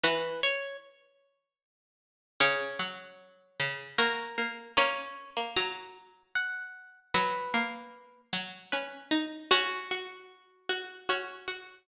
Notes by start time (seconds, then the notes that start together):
0.03 E3 F#4 B4
0.43 C#5
2.40 C#3 C#4 C#5
2.79 F#3
3.60 C#3
3.98 A#3 F#4 A#4
4.38 A#3
4.77 A#3 C#4 C#5
5.37 A#3
5.56 F#3 A#5
6.35 F#5
7.14 F#3 F#4 B4
7.54 A#3
8.33 F#3
8.72 C#4 B4
9.11 D#4
9.51 C#4 F#4
9.91 F#4
10.69 F#4
11.09 C#4 F#4
11.48 F#4